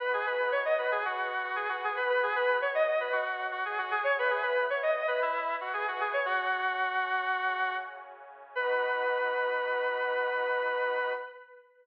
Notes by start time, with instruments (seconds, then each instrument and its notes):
0.00 pad 2 (warm) B3 D#4 F#4, lead 1 (square) B4
0.13 lead 1 (square) G#4
0.26 lead 1 (square) B4
0.52 lead 1 (square) C#5
0.65 lead 1 (square) D#5
0.78 lead 1 (square) B4
0.91 lead 1 (square) G#4
1.04 pad 2 (warm) B3 F#4 B4, lead 1 (square) F#4
1.43 lead 1 (square) F#4
1.56 lead 1 (square) G#4
1.69 lead 1 (square) F#4
1.84 lead 1 (square) G#4
1.96 lead 1 (square) B4
2.09 pad 2 (warm) B2 B3 F#4, lead 1 (square) B4
2.23 lead 1 (square) G#4
2.36 lead 1 (square) B4
2.61 lead 1 (square) C#5
2.75 lead 1 (square) D#5
2.87 lead 1 (square) D#5
3.00 lead 1 (square) B4
3.12 pad 2 (warm) B2 F#3 F#4, lead 1 (square) F#4
3.52 lead 1 (square) F#4
3.65 lead 1 (square) G#4
3.78 lead 1 (square) F#4
3.91 lead 1 (square) G#4
4.04 lead 1 (square) C#5
4.17 pad 2 (warm) E3 B3 E4, lead 1 (square) B4
4.30 lead 1 (square) G#4
4.42 lead 1 (square) B4
4.70 lead 1 (square) C#5
4.83 lead 1 (square) D#5
4.96 lead 1 (square) D#5
5.08 lead 1 (square) B4
5.22 pad 2 (warm) E3 E4 B4, lead 1 (square) E4
5.61 lead 1 (square) F#4
5.73 lead 1 (square) G#4
5.88 lead 1 (square) F#4
6.00 lead 1 (square) G#4
6.13 lead 1 (square) C#5
6.25 pad 2 (warm) F#2 F#3 C#4, lead 1 (square) F#4
7.35 pad 2 (warm) F#2 C#3 C#4
8.55 pad 2 (warm) B3 D#4 F#4, lead 1 (square) B4